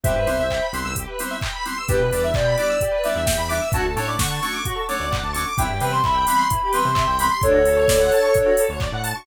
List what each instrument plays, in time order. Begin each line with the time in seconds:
0.03 synth bass 1 C2, electric piano 2 G3 B3 C4 E4, lead 1 (square) G4, ocarina C5 E5, kick, closed hi-hat
0.15 synth bass 1 G2, lead 1 (square) B4
0.26 synth bass 1 C2, electric piano 2 G3 B3 C4 E4, lead 1 (square) C5, open hi-hat
0.39 synth bass 1 C2, lead 1 (square) E5
0.50 lead 1 (square) G5, kick, clap
0.62 lead 1 (square) B5
0.73 synth bass 1 C2, electric piano 2 G3 B3 C4 E4, lead 1 (square) C6, open hi-hat
0.85 synth bass 1 C2, lead 1 (square) E6
0.96 lead 1 (square) G4, kick, closed hi-hat
1.07 lead 1 (square) B4
1.19 electric piano 2 G3 B3 C4 E4, lead 1 (square) C5, open hi-hat
1.31 lead 1 (square) E5
1.41 lead 1 (square) G5, kick, clap
1.53 lead 1 (square) B5
1.65 electric piano 2 G3 B3 C4 E4, lead 1 (square) C6, open hi-hat
1.78 lead 1 (square) E6
1.88 synth bass 1 E2, electric piano 2 G3 B3 D4 E4, lead 1 (square) G4, ocarina B4, kick, closed hi-hat
1.99 synth bass 1 B2, lead 1 (square) B4
2.11 synth bass 1 E2, electric piano 2 G3 B3 D4 E4, ocarina B4, lead 1 (square) D5, kick, open hi-hat
2.23 ocarina E5, lead 1 (square) E5
2.34 synth bass 1 B2, ocarina D5, lead 1 (square) G5, kick, clap
2.46 lead 1 (square) B5
2.57 electric piano 2 G3 B3 D4 E4, ocarina D5, lead 1 (square) D6, open hi-hat
2.70 lead 1 (square) E6
2.81 lead 1 (square) G4, kick, closed hi-hat
2.91 lead 1 (square) B4
3.04 electric piano 2 G3 B3 D4 E4, lead 1 (square) D5, ocarina E5, open hi-hat
3.15 synth bass 1 E2, lead 1 (square) E5
3.26 lead 1 (square) G5, kick, snare
3.37 synth bass 1 E2, lead 1 (square) B5
3.49 electric piano 2 G3 B3 D4 E4, ocarina E5, lead 1 (square) D6, open hi-hat
3.62 lead 1 (square) E6
3.72 synth bass 1 D2, electric piano 2 F#3 A3 C#4 D4, lead 1 (square) F#4, ocarina A5, kick, closed hi-hat
3.83 synth bass 1 D2, lead 1 (square) A4
3.96 synth bass 1 A2, electric piano 2 F#3 A3 C#4 D4, lead 1 (square) C#5, ocarina A5, open hi-hat
4.08 lead 1 (square) D5, ocarina D6
4.19 synth bass 1 D3, lead 1 (square) F#5, ocarina C#6, kick, snare
4.30 lead 1 (square) A5
4.42 electric piano 2 F#3 A3 C#4 D4, lead 1 (square) C#6, ocarina C#6, open hi-hat
4.53 lead 1 (square) D6
4.65 lead 1 (square) F#4, kick, closed hi-hat
4.75 lead 1 (square) A4
4.88 electric piano 2 F#3 A3 C#4 D4, lead 1 (square) C#5, ocarina D6, open hi-hat
5.00 synth bass 1 D2, lead 1 (square) D5
5.11 lead 1 (square) F#5, kick, clap
5.23 synth bass 1 D2, lead 1 (square) A5
5.33 electric piano 2 F#3 A3 C#4 D4, lead 1 (square) C#6, ocarina D6, open hi-hat
5.47 lead 1 (square) D6
5.57 synth bass 1 C2, electric piano 2 E3 G3 B3 C4, lead 1 (square) E4, ocarina G5, kick, closed hi-hat
5.69 synth bass 1 G2, lead 1 (square) G4
5.80 synth bass 1 C3, electric piano 2 E3 G3 B3 C4, lead 1 (square) B4, ocarina G5, open hi-hat
5.91 lead 1 (square) C5, ocarina C6
6.04 synth bass 1 C2, lead 1 (square) E5, ocarina B5, kick, clap
6.15 lead 1 (square) G5
6.27 electric piano 2 E3 G3 B3 C4, ocarina B5, lead 1 (square) B5, open hi-hat
6.37 lead 1 (square) C6
6.50 lead 1 (square) E4, kick, closed hi-hat
6.63 lead 1 (square) G4
6.71 electric piano 2 E3 G3 B3 C4, lead 1 (square) B4, ocarina C6, open hi-hat
6.85 synth bass 1 C3, lead 1 (square) C5
6.95 lead 1 (square) E5, kick, clap
7.07 synth bass 1 C2, lead 1 (square) G5
7.19 electric piano 2 E3 G3 B3 C4, lead 1 (square) B5, ocarina C6, open hi-hat
7.30 lead 1 (square) C6
7.42 synth bass 1 D2, lead 1 (square) D4, ocarina A4 C#5, kick, closed hi-hat
7.53 synth bass 1 D2, lead 1 (square) F#4
7.65 synth bass 1 D2, lead 1 (square) A4, open hi-hat
7.76 lead 1 (square) C#5
7.88 synth bass 1 D2, lead 1 (square) D5, kick, snare
8.00 lead 1 (square) F#5
8.12 lead 1 (square) A5, open hi-hat
8.23 lead 1 (square) C#6
8.34 lead 1 (square) D4, kick, closed hi-hat
8.46 lead 1 (square) F#4
8.57 lead 1 (square) A4, open hi-hat
8.69 synth bass 1 D2, lead 1 (square) C#5
8.80 lead 1 (square) D5, kick, clap
8.92 synth bass 1 A2, lead 1 (square) F#5
9.04 lead 1 (square) A5, open hi-hat
9.15 lead 1 (square) C#6